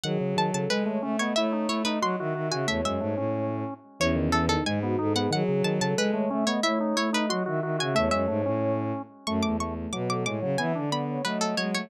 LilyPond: <<
  \new Staff \with { instrumentName = "Pizzicato Strings" } { \time 2/2 \key cis \minor \tempo 2 = 91 fis''4 a''8 a''8 b'4. cis''8 | e''4 cis''8 b'8 bis''4. gis''8 | e''8 e''2 r4. | cis''4 a'8 a'8 gis''4. fis''8 |
fis''4 a''8 a''8 b'4. cis''8 | e''4 cis''8 b'8 bis''4. gis''8 | e''8 e''2 r4. | \key fis \minor cis'''8 d'''8 cis'''4 d'''8 d'''8 d'''8 r8 |
gis''4 b''4 b'8 a'8 cis''8 cis''8 | }
  \new Staff \with { instrumentName = "Ocarina" } { \time 2/2 \key cis \minor gis'4. a'4 cis''8 e''8 dis''8 | cis''4. dis''4 e''8 e''8 e''8 | cis''2~ cis''8 r4. | cis'4. dis'4 fis'8 a'8 gis'8 |
gis'4. a'4 cis''8 e''8 dis''8 | cis''4. dis''4 e''8 e''8 e''8 | cis''2~ cis''8 r4. | \key fis \minor a4 a8 a8 b'8 a'8 cis''4 |
e''8 d''4 cis''8 dis''4. cis''8 | }
  \new Staff \with { instrumentName = "Drawbar Organ" } { \time 2/2 \key cis \minor dis8 cis8 dis8 cis8 gis8 a8 cis'8 b8 | e'8 dis'8 e'8 dis'8 fis'8 fis'8 fis'8 fis'8 | a8 gis8 a8 cis'2 r8 | e8 dis8 e8 dis8 gis8 b8 dis'8 b8 |
dis8 cis8 dis8 cis8 gis8 a8 cis'8 b8 | e'8 dis'8 e'8 dis'8 fis'8 fis'8 fis'8 fis'8 | a8 gis8 a8 cis'2 r8 | \key fis \minor a4 a8 r8 fis4 gis8 fis8 |
b8 d'8 b4 fis4 fis4 | }
  \new Staff \with { instrumentName = "Violin" } { \time 2/2 \key cis \minor fis2 gis4 a4 | a4 a4 fis8 dis8 dis8 cis8 | e,8 fis,8 gis,8 a,4. r4 | e,2 gis,4 gis,4 |
fis2 gis4 a4 | a4 a4 fis8 dis8 dis8 cis8 | e,8 fis,8 gis,8 a,4. r4 | \key fis \minor fis,8 e,4. b,4 a,8 cis8 |
e8 d4. a4 gis8 a8 | }
>>